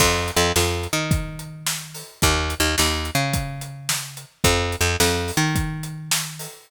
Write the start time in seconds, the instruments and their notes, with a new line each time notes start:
0.00 electric bass (finger) F2, kick, crash
0.28 closed hi-hat
0.36 electric bass (finger) F2
0.56 electric bass (finger) F2, snare
0.83 closed hi-hat
0.93 electric bass (finger) D#3
1.11 kick, closed hi-hat
1.39 closed hi-hat
1.67 snare
1.94 open hi-hat
2.22 electric bass (finger) D#2, kick, closed hi-hat
2.50 closed hi-hat
2.60 electric bass (finger) D#2
2.78 electric bass (finger) D#2, snare
3.05 closed hi-hat
3.15 electric bass (finger) C#3
3.33 kick, closed hi-hat
3.61 closed hi-hat
3.89 snare
4.17 closed hi-hat
4.44 electric bass (finger) F2, kick, closed hi-hat
4.72 closed hi-hat
4.81 electric bass (finger) F2
5.00 electric bass (finger) F2, snare
5.28 open hi-hat
5.37 electric bass (finger) D#3
5.56 kick, closed hi-hat
5.83 closed hi-hat
6.11 snare
6.39 open hi-hat